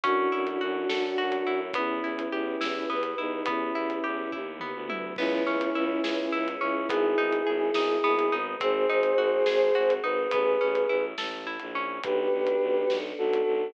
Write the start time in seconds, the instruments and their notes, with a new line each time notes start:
0.03 violin F#2, choir aahs A3 C#4 E4 F#4, orchestral harp C#4, flute D4 F#4, kick, closed hi-hat
0.32 violin F#2, orchestral harp E4
0.47 closed hi-hat
0.61 violin F#2, orchestral harp F#4
0.89 violin F#2, choir aahs A3 C#4 F#4 A4, orchestral harp A4, snare
1.18 violin F#2, orchestral harp F#4
1.32 closed hi-hat
1.46 violin F#2, orchestral harp E4
1.73 violin E2, orchestral harp B3, choir aahs B3 E4 G4, flute C#4 E4, kick, closed hi-hat
2.03 violin E2, orchestral harp E4
2.19 closed hi-hat
2.32 violin E2, orchestral harp G4
2.61 violin E2, choir aahs B3 G4 B4, orchestral harp E4, snare
2.90 violin E2, orchestral harp B3
3.03 closed hi-hat
3.18 violin E2, flute D#4, orchestral harp E4
3.46 violin E2, orchestral harp B3, choir aahs B3 E4 G4, flute C#4 E4, kick, closed hi-hat
3.75 violin E2, orchestral harp E4
3.90 closed hi-hat
4.04 violin E2, orchestral harp G4
4.32 violin D#2, choir aahs B3 G4 B4, orchestral harp E4, kick, floor tom
4.59 orchestral harp B3, mid tom
4.74 violin D2
4.89 orchestral harp E4, high tom
5.16 violin C#2, choir aahs B3 C#4 E4 G#4, orchestral harp B3, flute C#4 E4, kick, crash
5.46 violin C#2, orchestral harp C#4
5.61 closed hi-hat
5.75 violin C#2, orchestral harp E4
6.03 violin C#2, choir aahs B3 C#4 G#4 B4, orchestral harp G#4, snare
6.32 violin C#2, orchestral harp E4
6.48 closed hi-hat
6.61 violin C#2, orchestral harp C#4, flute C#4 E4
6.89 violin G#1, choir aahs B3 D#4 G#4, orchestral harp B3, flute E4 G#4, kick, closed hi-hat
7.17 violin G#1, orchestral harp D#4
7.33 closed hi-hat
7.46 violin G#1, orchestral harp G#4
7.74 violin G#1, choir aahs G#3 B3 G#4, orchestral harp D#4, snare
8.04 violin G#1, orchestral harp B3
8.19 closed hi-hat
8.31 violin G#1, orchestral harp D#4
8.60 violin G#1, choir aahs C4 D#4 F#4 G#4, orchestral harp C4, flute G#4 C5, kick, closed hi-hat
8.89 violin G#1, orchestral harp D#4
9.03 closed hi-hat
9.18 violin G#1, orchestral harp F#4
9.46 violin G#1, choir aahs C4 D#4 G#4 C5, orchestral harp G#4, snare
9.75 violin G#1, orchestral harp F#4
9.90 closed hi-hat
10.03 violin G#1, orchestral harp D#4, flute B4
10.31 violin A1, orchestral harp B3, flute G#4 B4, kick, closed hi-hat
10.61 violin A1, orchestral harp C#4
10.75 closed hi-hat
10.89 violin A1, orchestral harp E4
11.18 violin A1, orchestral harp A4, snare
11.47 orchestral harp E4
11.60 violin A#1, closed hi-hat
11.75 orchestral harp C#4
12.03 violin B1, choir aahs B3 D4 F#4 A4, flute G4 B4, kick, closed hi-hat
12.31 violin B1
12.47 closed hi-hat
12.61 violin B1
12.89 violin B1, choir aahs B3 D4 A4 B4, snare
13.18 violin B1, flute F#4 A4
13.33 closed hi-hat
13.46 violin B1